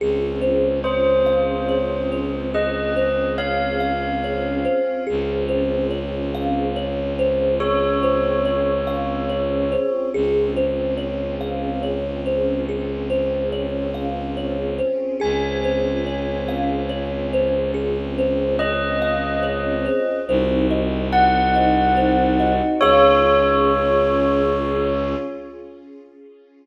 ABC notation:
X:1
M:3/4
L:1/8
Q:1/4=71
K:Db
V:1 name="Tubular Bells"
z2 c4 | e2 f4 | z6 | d6 |
z6 | z6 | a6 | z2 e4 |
z2 g4 | d6 |]
V:2 name="Kalimba"
A c d f d c | A c d f d c | A c d f d c | A c d f d c |
A c d f d c | A c d f d c | A c d f d c | A c d f d c |
c e g e c e | [Adf]6 |]
V:3 name="String Ensemble 1"
[CDFA]6- | [CDFA]6 | [CDFA]6- | [CDFA]6 |
[CDFA]6- | [CDFA]6 | [CDFA]6- | [CDFA]6 |
[CEG]6 | [DFA]6 |]
V:4 name="Violin" clef=bass
D,,6- | D,,6 | D,,6- | D,,6 |
D,,6- | D,,6 | D,,6- | D,,6 |
C,,6 | D,,6 |]